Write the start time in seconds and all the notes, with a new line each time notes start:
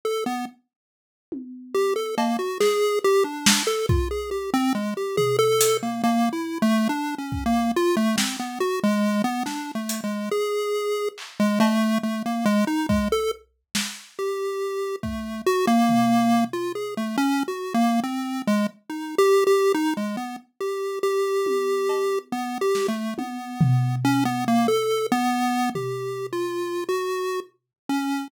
0.05 A4
0.26 B3
1.32 high tom
1.74 G4
1.96 A4
2.18 A#3, cowbell
2.39 F#4
2.60 G#4, snare
3.04 G4
3.24 D4
3.46 snare
3.67 A4
3.89 F4, kick
4.11 G#4
4.31 G4
4.54 C4
4.75 G#3
4.97 G4
5.17 G#4, floor tom
5.39 A4
5.61 closed hi-hat
5.83 A#3
6.04 A#3, cowbell
6.33 E4
6.62 A3
6.89 D4
7.18 C#4
7.32 kick
7.46 A#3
7.76 F4
7.97 A3
8.17 C4, snare
8.39 B3
8.60 F#4
8.84 G#3
9.24 B3
9.46 D4, snare
9.75 A3
9.89 closed hi-hat
10.04 G#3
10.31 G#4
11.18 clap
11.40 G#3
11.60 A3, cowbell
12.03 A3
12.26 A#3
12.46 G#3
12.67 D#4
12.89 G#3, kick
13.12 A4
13.75 snare
14.19 G4
15.03 A3, kick
15.46 F#4
15.67 A#3
15.89 floor tom
16.53 F4
16.75 G#4
16.97 A3
17.18 C#4
17.48 F#4
17.74 A#3
18.04 C4
18.47 G#3
18.90 D#4
19.18 G4
19.47 G4
19.74 D#4
19.97 G#3
20.17 B3
20.61 G4
21.03 G4
21.46 high tom
21.89 cowbell
22.32 B3
22.61 G4
22.75 snare
22.88 A3
23.18 B3, high tom
23.61 floor tom
24.05 C#4
24.25 B3
24.48 A#3
24.68 A4
25.12 B3
25.75 G4, floor tom
26.33 F4
26.89 F#4
27.89 C#4